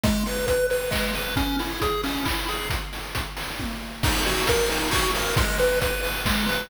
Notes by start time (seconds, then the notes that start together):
0.04 G#3, kick, closed hi-hat
0.26 B4, open hi-hat
0.47 B4, kick, closed hi-hat
0.70 B4, open hi-hat
0.91 G#3, kick, clap
1.14 B4, open hi-hat
1.36 C#4, kick, closed hi-hat
1.59 E4, open hi-hat
1.81 G#4, kick, closed hi-hat
2.04 C#4, open hi-hat
2.25 E4, kick, clap
2.48 G#4, open hi-hat
2.70 kick, closed hi-hat
2.93 open hi-hat
3.15 kick, closed hi-hat
3.37 open hi-hat
3.59 kick, high tom
4.03 D#4, kick, crash
4.26 F#4, open hi-hat
4.47 A#4, kick, closed hi-hat
4.69 D#4, open hi-hat
4.91 F#4, kick, clap
5.14 A#4, open hi-hat
5.36 G#3, kick, closed hi-hat
5.58 B4, open hi-hat
5.81 B4, kick, closed hi-hat
6.02 B4, open hi-hat
6.26 G#3, kick, clap
6.46 B4, open hi-hat